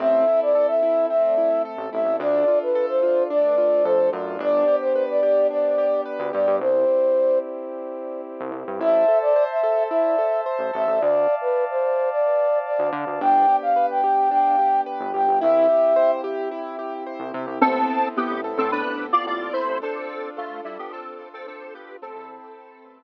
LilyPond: <<
  \new Staff \with { instrumentName = "Flute" } { \time 4/4 \key a \minor \tempo 4 = 109 e''8. d''8 e''8. e''4 r8 e''8 | d''8. b'8 c''8. d''4 c''8 r8 | d''8. c''8 d''8. d''4 r8 d''8 | c''4. r2 r8 |
e''8. d''8 e''8. e''4 r8 e''8 | d''8. b'8 c''8. d''4 d''8 r8 | g''8. f''8 g''8. g''4 r8 g''8 | e''4. r2 r8 |
r1 | r1 | r1 | }
  \new Staff \with { instrumentName = "Lead 1 (square)" } { \time 4/4 \key a \minor r1 | r1 | r1 | r1 |
r1 | r1 | r1 | r1 |
<c' a'>4 <b g'>8 r16 <c' a'>16 <d' b'>8. <f' d''>16 <f' d''>8 <e' c''>8 | <c' a'>4 <a f'>8 <g e'>16 <b g'>16 <c' a'>8. <c' a'>16 <c' a'>8 <b g'>8 | <c' a'>2 r2 | }
  \new Staff \with { instrumentName = "Acoustic Grand Piano" } { \time 4/4 \key a \minor c'8 e'8 a'8 e'8 c'8 e'8 a'8 e'8 | d'8 f'8 a'8 f'8 d'8 f'8 a'8 f'8 | d'8 g'8 b'8 g'8 d'8 g'8 b'8 g'8 | r1 |
e'8 a'8 c''8 a'8 e'8 a'8 c''8 a'8 | r1 | d'8 g'8 b'8 g'8 d'8 g'8 b'8 g'8 | e'8 g'8 c''8 g'8 e'8 g'8 c''8 g'8 |
b8 c'8 e'8 a'8 b8 c'8 e'8 a'8 | d'8 f'8 a'8 d'8 f'8 a'8 d'8 f'8 | c'8 e'8 a'8 b'8 r2 | }
  \new Staff \with { instrumentName = "Synth Bass 1" } { \clef bass \time 4/4 \key a \minor a,,2.~ a,,16 a,,16 a,,16 a,,16 | d,2. f,8 fis,8 | g,,2.~ g,,16 d,16 g,16 g,16 | c,2.~ c,16 c,16 c,16 g,16 |
a,,2.~ a,,16 a,,16 a,,16 a,,16 | d,2.~ d,16 d,16 d16 d,16 | g,,2.~ g,,16 g,,16 g,,16 g,,16 | c,2.~ c,16 c,16 c16 c,16 |
a,,4~ a,,16 a,,8 a,8 a,,8. a,,8. a,,16 | r1 | a,,16 e,4~ e,16 a,,4. r4 | }
  \new Staff \with { instrumentName = "Pad 2 (warm)" } { \time 4/4 \key a \minor <c' e' a'>2 <a c' a'>2 | <d' f' a'>2 <a d' a'>2 | <b d' g'>1 | <c' e' g'>1 |
<c'' e'' a''>1 | <d'' f'' a''>1 | <b d' g'>1 | <c' e' g'>1 |
<b c' e' a'>1 | <d' f' a'>1 | <c'' e'' a'' b''>1 | }
>>